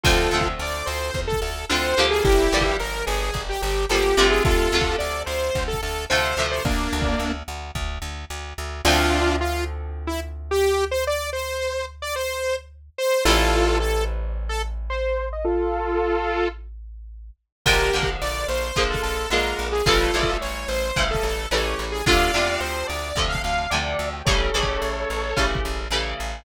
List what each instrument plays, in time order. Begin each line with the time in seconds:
0.03 electric bass (finger) D2, overdriven guitar D3 F3 A3 C4, lead 2 (sawtooth) F4 A4, kick, crash
0.31 electric bass (finger) D2, overdriven guitar D3 F3 A3 C4
0.41 kick
0.59 electric bass (finger) D2, lead 2 (sawtooth) D5
0.86 electric bass (finger) D2, lead 2 (sawtooth) C5
1.14 electric bass (finger) E2, kick
1.27 lead 2 (sawtooth) A4
1.32 kick
1.42 electric bass (finger) D2, lead 2 (sawtooth) A4
1.69 electric bass (finger) D2, overdriven guitar D3 F3 A3 C4, lead 2 (sawtooth) C5
1.97 electric bass (finger) D2, overdriven guitar D3 F3 G3 A#3
2.11 lead 2 (sawtooth) G#4
2.24 electric bass (finger) G1, lead 2 (sawtooth) E4 G4, kick
2.52 electric bass (finger) G1, overdriven guitar D3 F3 G3 A#3
2.61 kick
2.79 electric bass (finger) G1, lead 2 (sawtooth) A#4
3.06 electric bass (finger) G1, lead 2 (sawtooth) G#4
3.34 electric bass (finger) G1, kick
3.49 lead 2 (sawtooth) G4
3.62 electric bass (finger) G1, lead 2 (sawtooth) G4
3.89 electric bass (finger) G1, overdriven guitar D3 F3 G3 A#3, lead 2 (sawtooth) G4
4.17 electric bass (finger) G1, overdriven guitar C3 D3 F3 A3
4.30 lead 2 (sawtooth) G#4
4.44 electric bass (finger) D2, lead 2 (sawtooth) F4 A4, kick
4.72 electric bass (finger) D2, overdriven guitar C3 D3 F3 A3
4.81 kick
4.99 electric bass (finger) D2, lead 2 (sawtooth) D5
5.26 electric bass (finger) D2, lead 2 (sawtooth) C5
5.55 electric bass (finger) D2, kick
5.68 lead 2 (sawtooth) A4
5.73 kick
5.83 electric bass (finger) D2, lead 2 (sawtooth) A4
6.10 electric bass (finger) D2, overdriven guitar C3 D3 F3 A3, lead 2 (sawtooth) C5
6.37 electric bass (finger) D2, overdriven guitar C3 D3 F3 A3
6.51 lead 2 (sawtooth) C5
6.65 electric bass (finger) D2, lead 2 (sawtooth) A#3 D4, kick
6.93 electric bass (finger) D2
7.02 kick
7.19 electric bass (finger) D2
7.48 electric bass (finger) D2
7.75 electric bass (finger) D2, kick
8.02 electric bass (finger) D2
8.30 electric bass (finger) D2
8.58 electric bass (finger) D2
8.85 electric bass (finger) D2, overdriven guitar D3 F3 A3 C4, lead 2 (sawtooth) D4 F4
9.40 lead 2 (sawtooth) F4
10.07 lead 2 (sawtooth) E4
10.51 lead 2 (sawtooth) G4
10.91 lead 2 (sawtooth) C5
11.07 lead 2 (sawtooth) D5
11.33 lead 2 (sawtooth) C5
12.02 lead 2 (sawtooth) D5
12.16 lead 2 (sawtooth) C5
12.98 lead 2 (sawtooth) C5
13.25 electric bass (finger) A1, overdriven guitar E3 G3 A3 C4, lead 2 (sawtooth) F4 A4
13.80 lead 2 (sawtooth) A4
14.49 lead 2 (sawtooth) A4
14.90 lead 2 (sawtooth) C5
15.33 lead 2 (sawtooth) D#5
15.44 lead 2 (sawtooth) F4 A4
17.65 electric bass (finger) A#1, overdriven guitar D3 F3 G#3 A#3, lead 2 (sawtooth) G4 A#4, kick, crash
17.93 electric bass (finger) A#1, overdriven guitar D3 F3 G#3 A#3
18.03 kick
18.22 electric bass (finger) A#1, lead 2 (sawtooth) D5
18.48 electric bass (finger) A#1, lead 2 (sawtooth) C5
18.76 electric bass (finger) A#1, overdriven guitar D3 F3 G#3 A#3, kick
18.90 lead 2 (sawtooth) A4, kick
19.03 electric bass (finger) A#1, lead 2 (sawtooth) A4
19.30 electric bass (finger) A#1, overdriven guitar D3 F3 G#3 A#3, lead 2 (sawtooth) A#4
19.59 electric bass (finger) A#1
19.72 lead 2 (sawtooth) G#4
19.86 electric bass (finger) A1, overdriven guitar C#3 E3 G3 A3, lead 2 (sawtooth) F4 A4, kick
20.13 electric bass (finger) A1, overdriven guitar C#3 E3 G3 A3
20.23 kick
20.41 electric bass (finger) A1, lead 2 (sawtooth) C#5
20.68 electric bass (finger) A1, lead 2 (sawtooth) C5
20.96 electric bass (finger) A1, overdriven guitar C#3 E3 G3 A3, kick
21.11 lead 2 (sawtooth) A4
21.15 kick
21.23 electric bass (finger) A1, lead 2 (sawtooth) A4
21.51 electric bass (finger) A1, overdriven guitar C#3 E3 G3 A3, lead 2 (sawtooth) C#5
21.79 electric bass (finger) A1
21.92 lead 2 (sawtooth) G#4
22.06 electric bass (finger) D2, overdriven guitar C3 D3 F3 A3, lead 2 (sawtooth) D5 F5, kick
22.34 electric bass (finger) E2, overdriven guitar C3 D3 F3 A3
22.60 electric bass (finger) D2, lead 2 (sawtooth) C5
22.87 electric bass (finger) D2, lead 2 (sawtooth) D5
23.15 electric bass (finger) D2, overdriven guitar C3 D3 F3 A3, kick
23.29 lead 2 (sawtooth) F5
23.35 kick
23.44 electric bass (finger) D2, lead 2 (sawtooth) F5
23.70 electric bass (finger) D2, overdriven guitar C3 D3 F3 A3, lead 2 (sawtooth) D5
23.99 electric bass (finger) D2
24.13 lead 2 (sawtooth) G5
24.25 electric bass (finger) A1, overdriven guitar C#3 E3 G3 A3, lead 2 (sawtooth) A4 C#5, kick
24.54 electric bass (finger) A1, overdriven guitar C#3 E3 G3 A3
24.63 kick
24.82 electric bass (finger) A1
25.10 electric bass (finger) A1
25.36 electric bass (finger) A1, overdriven guitar C#3 E3 G3 A3, kick
25.55 kick
25.65 electric bass (finger) A1
25.90 electric bass (finger) A1, overdriven guitar C#3 E3 G3 A3
26.20 electric bass (finger) A1